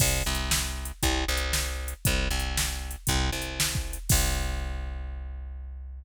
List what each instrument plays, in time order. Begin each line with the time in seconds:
0.00 electric bass (finger) C2, kick, crash
0.26 electric bass (finger) C2
0.35 closed hi-hat
0.51 snare
0.85 closed hi-hat
1.03 electric bass (finger) C2, kick, closed hi-hat
1.28 electric bass (finger) C2
1.37 closed hi-hat
1.53 snare
1.88 closed hi-hat
2.05 electric bass (finger) C2, kick, closed hi-hat
2.31 electric bass (finger) C2
2.40 closed hi-hat
2.57 snare
2.91 closed hi-hat
3.07 electric bass (finger) C2, kick, closed hi-hat
3.32 electric bass (finger) C2
3.42 closed hi-hat
3.60 snare
3.75 kick
3.93 closed hi-hat
4.09 electric bass (finger) C2, kick, crash